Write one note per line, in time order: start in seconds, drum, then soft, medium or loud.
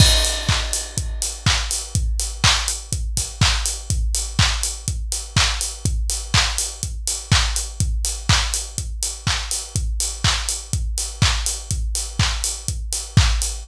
0.00 kick loud
0.00 crash loud
0.25 open hi-hat medium
0.49 kick medium
0.49 clap medium
0.73 open hi-hat medium
0.97 kick medium
0.97 closed hi-hat loud
1.22 open hi-hat medium
1.46 kick medium
1.46 clap loud
1.71 open hi-hat medium
1.95 kick loud
1.95 closed hi-hat loud
2.20 open hi-hat medium
2.44 kick medium
2.44 clap loud
2.68 open hi-hat medium
2.92 kick medium
2.92 closed hi-hat loud
3.17 kick medium
3.17 open hi-hat medium
3.41 kick medium
3.41 clap loud
3.66 open hi-hat medium
3.90 kick loud
3.90 closed hi-hat loud
4.15 open hi-hat medium
4.39 kick medium
4.39 clap loud
4.63 open hi-hat medium
4.88 kick medium
4.88 closed hi-hat loud
5.12 open hi-hat medium
5.36 kick medium
5.36 clap loud
5.61 open hi-hat medium
5.85 kick loud
5.85 closed hi-hat loud
6.10 open hi-hat medium
6.34 kick medium
6.34 clap loud
6.58 open hi-hat medium
6.83 kick medium
6.83 closed hi-hat loud
7.07 open hi-hat medium
7.32 kick medium
7.32 clap loud
7.56 open hi-hat medium
7.80 kick loud
7.80 closed hi-hat medium
8.05 open hi-hat medium
8.29 kick medium
8.29 clap loud
8.54 open hi-hat medium
8.78 kick medium
8.78 closed hi-hat loud
9.03 open hi-hat medium
9.27 kick medium
9.27 clap medium
9.51 open hi-hat medium
9.76 kick loud
9.76 closed hi-hat loud
10.00 open hi-hat medium
10.24 kick medium
10.24 clap loud
10.49 open hi-hat medium
10.73 kick medium
10.73 closed hi-hat medium
10.98 open hi-hat medium
11.22 kick medium
11.22 clap loud
11.46 open hi-hat medium
11.71 kick loud
11.71 closed hi-hat loud
11.95 open hi-hat medium
12.19 kick medium
12.19 clap loud
12.44 open hi-hat medium
12.68 kick medium
12.68 closed hi-hat loud
12.93 open hi-hat medium
13.17 kick loud
13.17 clap loud
13.42 open hi-hat medium